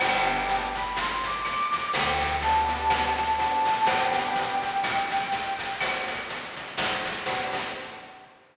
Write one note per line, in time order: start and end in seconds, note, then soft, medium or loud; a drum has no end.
0.00 1.56 G1 loud
0.00 0.68 B3 loud
0.00 0.68 D4 loud
0.00 0.68 G4 loud
0.00 0.65 G5 medium
0.00 cowbell loud
0.00 claves loud
0.00 shaker loud
0.26 shaker medium
0.49 shaker medium
0.75 0.96 B5 medium
0.75 shaker medium
0.96 1.23 C6 medium
0.96 shaker loud
1.23 1.92 D6 medium
1.23 shaker medium
1.45 snare soft
1.45 claves medium
1.45 shaker medium
1.72 shaker medium
1.93 3.49 D2 loud
1.93 2.36 G5 medium
1.93 cowbell medium
1.93 shaker loud
2.20 shaker medium
2.41 3.10 B3 loud
2.41 3.10 D4 medium
2.41 3.10 G4 loud
2.41 3.31 A5 medium
2.41 shaker medium
2.68 shaker medium
2.90 cowbell medium
2.90 claves medium
2.90 shaker loud
3.17 shaker medium
3.37 3.72 B3 medium
3.37 3.72 D4 loud
3.37 3.72 G4 loud
3.37 3.84 A5 medium
3.37 cowbell medium
3.37 shaker medium
3.65 snare medium
3.65 shaker medium
3.86 4.57 B3 loud
3.86 4.57 D4 loud
3.86 4.57 G4 loud
3.86 5.60 G5 loud
3.86 cowbell loud
3.86 shaker loud
4.13 shaker medium
4.35 shaker medium
4.62 shaker medium
4.83 claves loud
4.83 shaker loud
5.10 shaker medium
5.32 shaker medium
5.59 shaker medium
5.80 cowbell medium
5.80 claves loud
5.80 shaker loud
6.07 shaker medium
6.29 shaker medium
6.56 shaker medium
6.77 cowbell medium
6.77 shaker loud
7.05 shaker medium
7.26 7.61 B3 loud
7.26 7.61 D4 medium
7.26 7.61 G4 loud
7.26 cowbell medium
7.26 shaker loud
7.52 snare medium
7.52 shaker medium